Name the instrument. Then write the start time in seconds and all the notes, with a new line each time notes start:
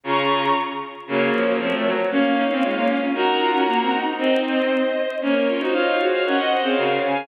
violin
0.04 C#3 C#4 F4 A#5 C#6
1.07 C#3 F#3 A#3 A#4 C#5
1.33 F3
1.46 F#3 A#3
1.59 F3 A3 C4
1.74 A3
1.86 F#3
2.10 A#3 C#4 C#5 F5
2.36 D#4
2.50 A#3 C4 C#4
2.62 G#3 C#4 F4
2.76 A#3
2.87 C#4
3.00 C#4
3.14 D#4 F#4 A#4 F#5 A#5
3.41 F4
3.53 C#4 F#4 A#4
3.66 A#3 F#4 A#4
3.81 C4
3.92 D#4
4.05 D#4
4.18 C4 D#4 C5 D#5
4.44 C5 D#5
5.21 A#3 C#4 A#4 C#5
5.48 C#4 F4
5.59 D#4 F#4 C5 D#5
5.73 F4 C#5 F5
5.99 F#4 G#4 C5
6.13 C#5 F5
6.25 C#4 A#4 C#5 D#5 F#5
6.38 C5 D#5
6.50 C5 D#5
6.62 C4 G#4 C5 C#5 F5
6.77 C#3 F#4 A#4
7.03 C#3 F5 G#5